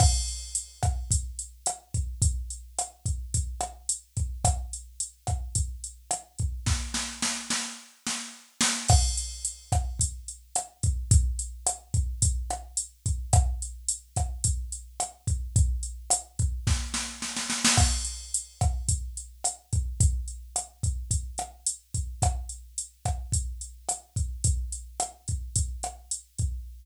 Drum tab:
CC |x---------------|----------------|----------------|----------------|
HH |--x-x-x-x-x-x-x-|x-x-x-x-x-x-x-x-|x-x-x-x-x-x-x-x-|----------------|
SD |r-----r-----r---|----r-----r-----|r-----r-----r---|o-o-o-o---o---o-|
BD |o-----o-o-----o-|o-----o-o-----o-|o-----o-o-----o-|o---------------|

CC |x---------------|----------------|----------------|----------------|
HH |--x-x-x-x-x-x-x-|x-x-x-x-x-x-x-x-|x-x-x-x-x-x-x-x-|x-x-x-x---------|
SD |r-----r-----r---|----r-----r-----|r-----r-----r---|----r---o-o-oooo|
BD |o-----o-o-----o-|o-----o-o-----o-|o-----o-o-----o-|o-----o-o-------|

CC |x---------------|----------------|----------------|----------------|
HH |--x-x-x-x-x-x-x-|x-x-x-x-x-x-x-x-|x-x-x-x-x-x-x-x-|x-x-x-x-x-x-x-x-|
SD |r-----r-----r---|----r-----r-----|r-----r-----r---|----r-----r-----|
BD |o-----o-o-----o-|o-----o-o-----o-|o-----o-o-----o-|o-----o-o-----o-|